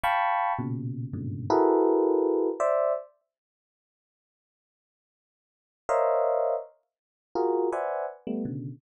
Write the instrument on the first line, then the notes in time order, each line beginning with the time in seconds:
electric piano 1
0.04 F5 G5 A5 B5 C#6
0.59 A#2 B2 C#3
1.13 G2 G#2 A#2 B2 C#3 D3
1.50 E4 F#4 G#4 A4 A#4 B4
2.60 C5 D5 E5
5.89 A#4 C5 C#5 D#5 E5 F5
7.35 F4 F#4 G#4 A#4
7.72 B4 C5 D5 E5 F#5 G#5
8.27 G3 A3 B3
8.45 B2 C#3 D3